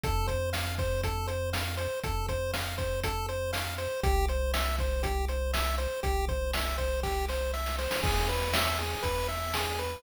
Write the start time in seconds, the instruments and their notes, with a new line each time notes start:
0.03 synth bass 1 F2, lead 1 (square) A4, kick, closed hi-hat
0.28 lead 1 (square) C5, kick, closed hi-hat
0.53 lead 1 (square) F5, snare
0.78 lead 1 (square) C5, kick, closed hi-hat
1.03 lead 1 (square) A4, kick, closed hi-hat
1.27 lead 1 (square) C5, closed hi-hat
1.53 lead 1 (square) F5, snare
1.77 lead 1 (square) C5, closed hi-hat
2.03 synth bass 1 F2, lead 1 (square) A4, kick, closed hi-hat
2.29 lead 1 (square) C5, kick, closed hi-hat
2.54 lead 1 (square) F5, snare
2.78 lead 1 (square) C5, kick, closed hi-hat
3.04 lead 1 (square) A4, kick, closed hi-hat
3.29 lead 1 (square) C5, closed hi-hat
3.53 lead 1 (square) F5, snare
3.78 lead 1 (square) C5, closed hi-hat
4.03 synth bass 1 C2, lead 1 (square) G4, kick, closed hi-hat
4.28 lead 1 (square) C5, closed hi-hat
4.54 lead 1 (square) E5, snare
4.79 lead 1 (square) C5, kick, closed hi-hat
5.03 lead 1 (square) G4, kick, closed hi-hat
5.28 lead 1 (square) C5, closed hi-hat
5.53 lead 1 (square) E5, snare
5.78 lead 1 (square) C5, closed hi-hat
6.03 synth bass 1 C2, lead 1 (square) G4, kick, closed hi-hat
6.28 lead 1 (square) C5, kick, closed hi-hat
6.53 lead 1 (square) E5, snare
6.78 lead 1 (square) C5, kick, closed hi-hat
7.03 lead 1 (square) G4, kick, snare
7.29 lead 1 (square) C5, snare
7.53 lead 1 (square) E5, snare
7.66 snare
7.78 lead 1 (square) C5, snare
7.91 snare
8.03 synth bass 1 E2, lead 1 (square) G#4, kick, crash
8.29 lead 1 (square) B4, closed hi-hat
8.53 lead 1 (square) E5, snare
8.78 lead 1 (square) G#4, closed hi-hat
9.03 synth bass 1 E2, lead 1 (square) B4, kick, closed hi-hat
9.28 lead 1 (square) E5, closed hi-hat
9.54 lead 1 (square) G#4, snare
9.79 lead 1 (square) B4, closed hi-hat